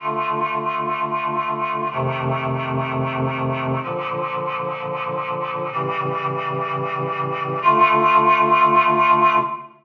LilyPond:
\new Staff { \time 4/4 \key d \minor \tempo 4 = 126 <d a f'>1 | <f, c ees a>1 | <bes, d f>1 | <a, cis e g>1 |
<d a f'>1 | }